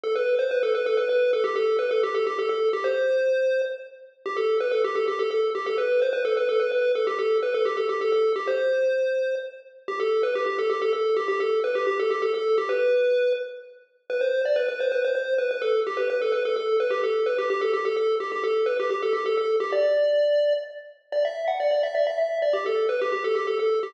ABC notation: X:1
M:3/4
L:1/16
Q:1/4=128
K:G
V:1 name="Lead 1 (square)"
A B2 c B A B A B B2 A | G A2 B A G A G A A2 G | c8 z4 | G A2 B A G A G A A2 G |
A B2 c B A B A B B2 A | G A2 B A G A G A A2 G | c8 z4 | G A2 B G G A G A A2 G |
G A2 B G G A G A A2 G | B6 z6 | B c2 d B B c B c c2 B | B A2 G B B A B A A2 B |
G A2 B G G A G A A2 G | G A2 B G G A G A A2 G | d8 z4 | d e2 f d d e d e e2 d |
G A2 B G G A G A A2 G |]